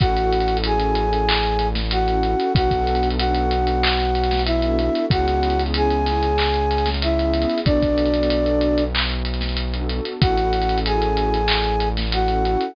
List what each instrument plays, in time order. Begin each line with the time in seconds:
0.00 synth bass 1 A1, pad 2 (warm) C#4 E4 F#4 A4, flute F#4 F#5, kick, closed hi-hat
0.16 pad 2 (warm) C#4 E4 F#4 A4, closed hi-hat
0.32 closed hi-hat
0.40 closed hi-hat
0.48 pad 2 (warm) C#4 E4 F#4 A4, closed hi-hat
0.57 closed hi-hat
0.64 pad 2 (warm) C#4 E4 F#4 A4, flute G#4 G#5, closed hi-hat
0.80 closed hi-hat
0.95 closed hi-hat
1.13 closed hi-hat
1.29 clap
1.43 closed hi-hat
1.59 closed hi-hat
1.75 snare, closed hi-hat
1.91 flute F#4 F#5, closed hi-hat
2.07 pad 2 (warm) C#4 E4 F#4 A4, closed hi-hat
2.23 pad 2 (warm) C#4 E4 F#4 A4, closed hi-hat
2.40 closed hi-hat
2.55 synth bass 1 B1, pad 2 (warm) B3 D4 F#4 A4, flute F#4 F#5, kick, closed hi-hat
2.71 pad 2 (warm) B3 D4 F#4 A4, kick, closed hi-hat
2.87 closed hi-hat
2.95 closed hi-hat
3.03 pad 2 (warm) B3 D4 F#4 A4, closed hi-hat
3.10 closed hi-hat
3.18 pad 2 (warm) B3 D4 F#4 A4, flute F#4 F#5, closed hi-hat
3.35 closed hi-hat
3.51 closed hi-hat
3.67 closed hi-hat
3.83 clap
3.99 snare, closed hi-hat
4.15 closed hi-hat
4.24 closed hi-hat
4.31 snare, closed hi-hat
4.39 closed hi-hat
4.46 flute E4 E5, closed hi-hat
4.62 pad 2 (warm) B3 D4 F#4 A4, closed hi-hat
4.79 pad 2 (warm) B3 D4 F#4 A4, closed hi-hat
4.95 closed hi-hat
5.10 synth bass 1 C#2, pad 2 (warm) B3 C#4 E4 G#4, flute F#4 F#5, kick, closed hi-hat
5.27 pad 2 (warm) B3 C#4 E4 G#4, closed hi-hat
5.43 closed hi-hat
5.50 closed hi-hat
5.59 pad 2 (warm) B3 C#4 E4 G#4, closed hi-hat
5.66 closed hi-hat
5.74 pad 2 (warm) B3 C#4 E4 G#4, flute G#4 G#5, closed hi-hat
5.90 closed hi-hat
6.06 snare, closed hi-hat
6.23 closed hi-hat
6.38 clap
6.54 closed hi-hat
6.71 closed hi-hat
6.78 closed hi-hat
6.86 snare, closed hi-hat
6.94 closed hi-hat
7.02 flute E4 E5, closed hi-hat
7.18 pad 2 (warm) B3 C#4 E4 G#4, closed hi-hat
7.34 pad 2 (warm) B3 C#4 E4 G#4, closed hi-hat
7.42 closed hi-hat
7.49 closed hi-hat
7.58 closed hi-hat
7.65 synth bass 1 B1, pad 2 (warm) B3 D4 F#4 A4, flute D4 D5, kick, closed hi-hat
7.82 pad 2 (warm) B3 D4 F#4 A4, kick, closed hi-hat
7.98 closed hi-hat
8.05 closed hi-hat
8.14 pad 2 (warm) B3 D4 F#4 A4, closed hi-hat
8.23 closed hi-hat
8.30 pad 2 (warm) B3 D4 F#4 A4, closed hi-hat
8.46 closed hi-hat
8.61 closed hi-hat
8.78 closed hi-hat
8.95 clap
9.10 closed hi-hat
9.25 closed hi-hat
9.34 closed hi-hat
9.41 snare, closed hi-hat
9.49 closed hi-hat
9.57 closed hi-hat
9.73 pad 2 (warm) B3 D4 F#4 A4, closed hi-hat
9.89 pad 2 (warm) B3 D4 F#4 A4, closed hi-hat
10.05 closed hi-hat
10.21 synth bass 1 A1, pad 2 (warm) C#4 E4 F#4 A4, flute F#4 F#5, kick, closed hi-hat
10.38 pad 2 (warm) C#4 E4 F#4 A4, closed hi-hat
10.53 closed hi-hat
10.62 closed hi-hat
10.69 pad 2 (warm) C#4 E4 F#4 A4, closed hi-hat
10.78 closed hi-hat
10.85 pad 2 (warm) C#4 E4 F#4 A4, flute G#4 G#5, closed hi-hat
11.02 closed hi-hat
11.17 closed hi-hat
11.34 closed hi-hat
11.48 clap
11.64 closed hi-hat
11.80 closed hi-hat
11.97 snare, closed hi-hat
12.12 flute F#4 F#5, closed hi-hat
12.28 pad 2 (warm) C#4 E4 F#4 A4, closed hi-hat
12.44 pad 2 (warm) C#4 E4 F#4 A4, closed hi-hat
12.61 closed hi-hat